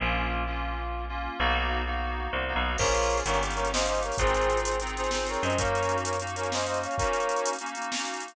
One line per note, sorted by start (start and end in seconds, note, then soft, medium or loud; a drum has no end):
0.00 1.28 A#1 medium
0.00 0.43 A#3 medium
0.00 0.43 C#4 medium
0.00 0.43 F4 medium
0.47 1.04 A#3 medium
0.47 1.04 C#4 medium
0.47 1.04 F4 medium
1.09 1.38 A#3 medium
1.09 1.38 C#4 medium
1.09 1.38 F4 medium
1.39 2.28 B1 medium
1.39 1.82 A#3 loud
1.39 1.82 B3 medium
1.39 1.82 D#4 medium
1.39 1.82 F#4 loud
1.86 2.43 A#3 medium
1.86 2.43 B3 medium
1.86 2.43 D#4 medium
1.86 2.43 F#4 medium
2.33 2.54 C2 medium
2.48 2.77 A#3 medium
2.48 2.77 B3 medium
2.48 2.77 D#4 medium
2.48 2.77 F#4 medium
2.56 2.77 B1 medium
2.78 3.22 A#1 medium
2.78 3.22 A#3 medium
2.78 3.22 C#4 medium
2.78 3.22 F4 medium
2.78 3.22 G#4 medium
2.78 3.18 A#4 medium
2.78 3.18 C#5 loud
2.78 kick loud
2.78 crash loud
2.86 closed hi-hat medium
2.94 closed hi-hat medium
3.03 closed hi-hat medium
3.10 closed hi-hat medium
3.17 closed hi-hat medium
3.25 4.11 G1 medium
3.25 3.40 A#3 medium
3.25 3.40 C#4 medium
3.25 3.40 D#4 medium
3.25 3.40 G4 medium
3.25 3.40 A#4 medium
3.25 3.40 C#5 loud
3.25 closed hi-hat loud
3.34 closed hi-hat medium
3.41 3.55 A#3 medium
3.41 3.55 C#4 medium
3.41 3.55 D#4 medium
3.41 3.55 G4 medium
3.41 closed hi-hat medium
3.50 closed hi-hat medium
3.55 3.71 A#3 medium
3.55 3.71 C#4 medium
3.55 3.71 D#4 medium
3.55 3.71 G4 medium
3.55 3.68 A#4 medium
3.55 3.68 C#5 medium
3.55 closed hi-hat medium
3.65 closed hi-hat medium
3.72 4.16 A#3 medium
3.72 4.16 C#4 medium
3.72 4.16 D#4 medium
3.72 4.16 G4 medium
3.72 3.86 C5 medium
3.72 3.86 D#5 medium
3.72 snare loud
3.81 closed hi-hat medium
3.86 4.00 C5 medium
3.86 4.00 D#5 medium
3.86 closed hi-hat medium
3.95 closed hi-hat medium
4.03 4.17 A#4 medium
4.03 4.17 C#5 medium
4.03 closed hi-hat medium
4.12 open hi-hat medium
4.18 5.36 G#1 medium
4.18 4.75 C4 medium
4.18 4.75 D#4 medium
4.18 4.75 F4 medium
4.18 4.75 G#4 medium
4.18 4.59 G#4 medium
4.18 4.59 C5 loud
4.18 kick loud
4.18 closed hi-hat loud
4.27 closed hi-hat medium
4.34 closed hi-hat medium
4.41 closed hi-hat medium
4.50 closed hi-hat medium
4.57 closed hi-hat medium
4.64 4.79 G#4 medium
4.64 4.79 C5 medium
4.64 closed hi-hat loud
4.71 closed hi-hat medium
4.80 4.95 C4 medium
4.80 4.95 D#4 medium
4.80 4.95 F4 medium
4.80 4.95 G#4 medium
4.80 closed hi-hat medium
4.87 closed hi-hat medium
4.97 5.11 C4 medium
4.97 5.11 D#4 medium
4.97 5.11 F4 medium
4.97 5.11 G#4 medium
4.97 5.10 G#4 medium
4.97 5.10 C5 medium
4.97 closed hi-hat medium
5.04 closed hi-hat medium
5.11 5.54 C4 medium
5.11 5.54 D#4 medium
5.11 5.54 F4 medium
5.11 5.54 G#4 medium
5.11 5.27 G#4 medium
5.11 5.27 C5 medium
5.11 snare medium
5.26 5.43 A#4 medium
5.26 5.43 C#5 medium
5.26 closed hi-hat medium
5.34 closed hi-hat medium
5.43 6.87 F#2 medium
5.43 5.57 C5 medium
5.43 5.57 D#5 medium
5.43 closed hi-hat medium
5.50 closed hi-hat medium
5.58 6.15 A#3 medium
5.58 6.15 C#4 medium
5.58 6.15 D#4 medium
5.58 6.15 F#4 medium
5.58 5.97 A#4 medium
5.58 5.97 C#5 loud
5.58 kick loud
5.58 closed hi-hat loud
5.65 closed hi-hat medium
5.75 closed hi-hat medium
5.83 closed hi-hat medium
5.89 closed hi-hat medium
5.98 closed hi-hat medium
6.05 6.18 A#4 medium
6.05 6.18 C#5 medium
6.05 closed hi-hat loud
6.13 closed hi-hat medium
6.20 6.34 A#3 medium
6.20 6.34 C#4 medium
6.20 6.34 D#4 medium
6.20 6.34 F#4 medium
6.20 closed hi-hat medium
6.27 closed hi-hat medium
6.36 6.50 A#3 medium
6.36 6.50 C#4 medium
6.36 6.50 D#4 medium
6.36 6.50 F#4 medium
6.36 6.50 A#4 medium
6.36 6.50 C#5 medium
6.36 closed hi-hat medium
6.43 closed hi-hat medium
6.51 6.94 A#3 medium
6.51 6.94 C#4 medium
6.51 6.94 D#4 medium
6.51 6.94 F#4 medium
6.51 6.66 C5 medium
6.51 6.66 D#5 medium
6.51 snare medium
6.59 closed hi-hat medium
6.66 6.79 C5 medium
6.66 6.79 D#5 medium
6.66 closed hi-hat medium
6.74 closed hi-hat medium
6.83 6.96 C#5 medium
6.83 6.96 F5 medium
6.83 closed hi-hat medium
6.91 closed hi-hat medium
6.98 7.55 A#3 medium
6.98 7.55 C#4 medium
6.98 7.55 D#4 medium
6.98 7.55 F#4 medium
6.98 7.49 A#4 medium
6.98 7.49 C#5 medium
6.98 kick loud
6.98 closed hi-hat medium
7.04 closed hi-hat medium
7.13 closed hi-hat medium
7.20 closed hi-hat medium
7.29 closed hi-hat medium
7.36 closed hi-hat medium
7.45 closed hi-hat loud
7.53 closed hi-hat medium
7.59 7.74 A#3 medium
7.59 7.74 C#4 medium
7.59 7.74 D#4 medium
7.59 7.74 F#4 medium
7.59 closed hi-hat medium
7.66 closed hi-hat medium
7.75 7.90 A#3 medium
7.75 7.90 C#4 medium
7.75 7.90 D#4 medium
7.75 7.90 F#4 medium
7.75 closed hi-hat medium
7.82 closed hi-hat medium
7.91 8.34 A#3 medium
7.91 8.34 C#4 medium
7.91 8.34 D#4 medium
7.91 8.34 F#4 medium
7.91 snare loud
7.98 closed hi-hat medium
8.05 closed hi-hat medium
8.14 closed hi-hat medium
8.20 closed hi-hat medium
8.28 closed hi-hat medium